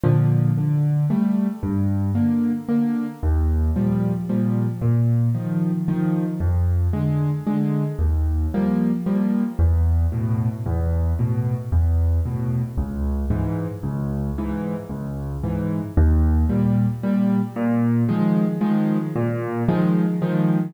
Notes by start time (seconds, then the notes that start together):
0.04 A#2 D3 F3
0.57 D3
1.10 G3 A3
1.63 G2
2.15 D3 A#3
2.69 D3 A#3
3.23 D#2
3.76 A#2 F3 G3
4.29 A#2 F3 G3
4.82 A#2
5.34 D#3 F3
5.88 D#3 F3
6.40 F2
6.93 D3 G#3
7.47 D3 G#3
7.99 D#2
8.54 F3 G3 A#3
9.06 F3 G3 A#3
9.59 E2
10.12 A2 B2
10.66 E2
11.19 A2 B2
11.72 E2
12.26 A2 B2
12.77 C#2
13.30 G#2 E3
13.83 C#2
14.38 G#2 E3
14.89 C#2
15.43 G#2 E3
15.97 D#2
16.49 A#2 G3
17.03 A#2 G3
17.56 A#2
18.09 D#3 F3 G#3
18.61 D#3 F3 G#3
19.16 A#2
19.68 D#3 F3 G#3
20.22 D#3 F3 G#3